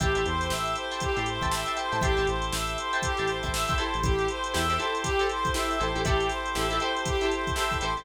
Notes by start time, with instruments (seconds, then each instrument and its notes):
0.00 synth bass 1 A1, drawbar organ C4 E4 G4 A4, clarinet G4, acoustic guitar (steel) E5 G5 A5 C6, kick, closed hi-hat
0.15 synth bass 1 A1, acoustic guitar (steel) E5 G5 A5 C6, closed hi-hat
0.26 synth bass 1 E2, clarinet C5, closed hi-hat
0.41 snare, closed hi-hat
0.50 synth bass 1 A1, clarinet E5, snare
0.65 closed hi-hat
0.76 clarinet C5, closed hi-hat
0.91 acoustic guitar (steel) E5 G5 A5 C6, closed hi-hat
1.00 clarinet G4, kick, closed hi-hat
1.16 synth bass 1 A2, acoustic guitar (steel) E5 G5 A5 C6, closed hi-hat
1.26 clarinet C5, closed hi-hat
1.41 synth bass 1 A1, acoustic guitar (steel) E5 G5 A5 C6, kick, closed hi-hat
1.51 clarinet E5, snare
1.66 acoustic guitar (steel) E5 G5 A5 C6, closed hi-hat
1.77 clarinet C5, acoustic guitar (steel) E5 G5 A5 C6, closed hi-hat
1.92 synth bass 1 A2, acoustic guitar (steel) E5 G5 A5 C6, snare, closed hi-hat
2.01 synth bass 1 A1, drawbar organ C4 E4 G4 A4, clarinet G4, acoustic guitar (steel) E5 G5 A5 C6, kick, closed hi-hat
2.17 synth bass 1 A1, acoustic guitar (steel) E5 G5 A5 C6, closed hi-hat
2.27 synth bass 1 A1, clarinet C5, closed hi-hat
2.42 closed hi-hat
2.53 synth bass 1 A1, clarinet E5, snare
2.67 closed hi-hat
2.78 clarinet C5, closed hi-hat
2.93 acoustic guitar (steel) E5 G5 A5 C6, closed hi-hat
3.02 clarinet G4, kick, closed hi-hat
3.17 synth bass 1 A1, acoustic guitar (steel) E5 G5 A5 C6, closed hi-hat
3.27 clarinet C5, snare, closed hi-hat
3.43 synth bass 1 A1, acoustic guitar (steel) E5 G5 A5 C6, kick, snare, closed hi-hat
3.53 clarinet E5, snare
3.68 acoustic guitar (steel) E5 G5 A5 C6, kick, closed hi-hat
3.78 acoustic guitar (steel) E4 G4 A4 C5, clarinet C5, closed hi-hat
3.94 synth bass 1 A1, closed hi-hat
4.03 synth bass 1 A1, drawbar organ C4 E4 G4 A4, clarinet G4, kick, closed hi-hat
4.19 closed hi-hat
4.28 clarinet C5, closed hi-hat
4.44 closed hi-hat
4.54 synth bass 1 E2, acoustic guitar (steel) E4 G4 A4 C5, clarinet E5, snare
4.69 acoustic guitar (steel) E4 G4 A4 C5, snare, closed hi-hat
4.78 acoustic guitar (steel) E4 G4 A4 C5, clarinet C5, closed hi-hat
4.95 closed hi-hat
5.03 clarinet G4, kick, closed hi-hat
5.19 acoustic guitar (steel) E4 G4 A4 C5, closed hi-hat
5.29 clarinet C5, closed hi-hat
5.45 kick, closed hi-hat
5.54 acoustic guitar (steel) E4 G4 A4 C5, clarinet E5, snare
5.70 snare, closed hi-hat
5.78 synth bass 1 A1, acoustic guitar (steel) E4 G4 A4 C5, clarinet C5, closed hi-hat
5.95 synth bass 1 A1, acoustic guitar (steel) E4 G4 A4 C5, closed hi-hat
6.05 synth bass 1 A1, drawbar organ C4 E4 G4 A4, acoustic guitar (steel) E4 G4 A4 C5, clarinet G4, kick, closed hi-hat
6.20 closed hi-hat
6.29 clarinet C5, snare, closed hi-hat
6.46 closed hi-hat
6.55 synth bass 1 A1, acoustic guitar (steel) E4 G4 A4 C5, clarinet E5, snare
6.70 acoustic guitar (steel) E4 G4 A4 C5, closed hi-hat
6.80 acoustic guitar (steel) E4 G4 A4 C5, clarinet C5, closed hi-hat
6.96 closed hi-hat
7.05 clarinet G4, kick, closed hi-hat
7.21 acoustic guitar (steel) E4 G4 A4 C5, closed hi-hat
7.31 clarinet C5, closed hi-hat
7.47 kick, closed hi-hat
7.55 acoustic guitar (steel) E4 G4 A4 C5, clarinet E5, snare
7.71 kick, closed hi-hat
7.81 synth bass 1 A1, acoustic guitar (steel) E4 G4 A4 C5, clarinet C5, closed hi-hat
7.97 synth bass 1 A1, acoustic guitar (steel) E4 G4 A4 C5, closed hi-hat